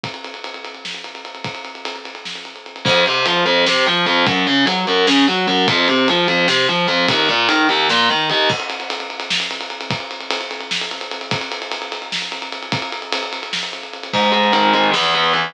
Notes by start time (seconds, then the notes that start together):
0.04 kick, ride
0.14 ride
0.24 ride
0.34 ride
0.44 ride
0.54 ride
0.65 ride
0.74 ride
0.85 snare
0.94 ride
1.04 ride
1.15 ride
1.25 ride
1.35 ride
1.44 kick, ride
1.55 ride
1.65 ride
1.75 ride
1.85 ride
1.96 ride
2.05 ride
2.15 ride
2.25 snare
2.35 ride
2.45 ride
2.56 ride
2.66 ride
2.76 ride
2.85 F2, kick, crash
3.06 C3, ride
3.26 F3, ride
3.46 F2, ride
3.66 C3, snare
3.86 F3, ride
4.06 F2, ride
4.26 F#2, kick, ride
4.47 C#3, ride
4.66 F#3, ride
4.87 F#2, ride
5.07 C#3, snare
5.27 F#3, ride
5.47 F#2, ride
5.68 F2, kick, ride
5.88 C3, ride
6.08 F3, ride
6.28 F2, ride
6.48 C3, snare
6.68 F3, ride
6.88 F2, ride
7.08 D#2, kick, ride
7.29 A#2, ride
7.49 D#3, ride
7.69 D#2, ride
7.89 A#2, snare
8.09 D#3, ride
8.30 D#2, ride
8.50 kick, crash
8.60 ride
8.70 ride
8.80 ride
8.90 ride
9.00 ride
9.10 ride
9.20 ride
9.30 snare
9.40 ride
9.51 ride
9.61 ride
9.70 ride
9.81 ride
9.90 kick, ride
10.00 ride
10.11 ride
10.20 ride
10.31 ride
10.41 ride
10.51 ride
10.61 ride
10.71 snare
10.81 ride
10.91 ride
11.01 ride
11.11 ride
11.21 ride
11.31 kick, ride
11.41 ride
11.52 ride
11.62 ride
11.72 ride
11.82 ride
11.92 ride
12.02 ride
12.12 snare
12.22 ride
12.32 ride
12.42 ride
12.52 ride
12.63 ride
12.72 kick, ride
12.82 ride
12.92 ride
13.02 ride
13.13 ride
13.23 ride
13.33 ride
13.43 ride
13.53 snare
13.63 ride
13.73 ride
13.83 ride
13.93 ride
14.03 ride
14.13 G#2, kick, crash
14.23 ride
14.32 G#3, ride
14.44 ride
14.52 D#3, ride
14.63 ride
14.73 G#3, ride
14.84 ride
14.93 E2, snare
15.04 ride
15.14 B3, ride
15.24 ride
15.33 E3, ride
15.44 ride